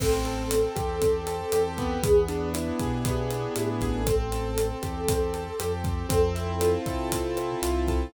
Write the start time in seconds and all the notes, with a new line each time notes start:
0.00 A1 C4 A4, kick, cross-stick, crash
0.25 A4, closed hi-hat
0.51 C4, closed hi-hat
0.76 E2 G4, kick, cross-stick, closed hi-hat
1.01 C4, kick, closed hi-hat
1.27 A4, closed hi-hat
1.52 E2 G4, cross-stick, closed hi-hat
1.78 B3, kick, closed hi-hat
2.03 E2 G#4, kick, closed hi-hat
2.28 D4, closed hi-hat
2.54 E4, cross-stick, closed hi-hat
2.79 B2 G4 G#4, kick, closed hi-hat
3.05 B3, kick, closed hi-hat
3.31 D4, cross-stick, closed hi-hat
3.55 A2 E4, closed hi-hat
3.81 A1 G4 G#4, kick, closed hi-hat
3.94 A4
4.06 C4 A4, kick, cross-stick, closed hi-hat
4.32 A4, closed hi-hat
4.58 C4, closed hi-hat
4.82 E2 G4, kick, cross-stick, closed hi-hat
5.08 C4, kick, closed hi-hat
5.34 A4, closed hi-hat
5.60 F2 G4, cross-stick, closed hi-hat
5.84 C4, kick, closed hi-hat
6.09 F2 C4 A4, kick, closed hi-hat
6.35 E4, closed hi-hat
6.61 F4, cross-stick, closed hi-hat
6.86 C3 A4, kick, closed hi-hat
7.12 C4, kick, closed hi-hat
7.37 E4, cross-stick, closed hi-hat
7.62 C2 F4, closed hi-hat
7.88 A4, kick, closed hi-hat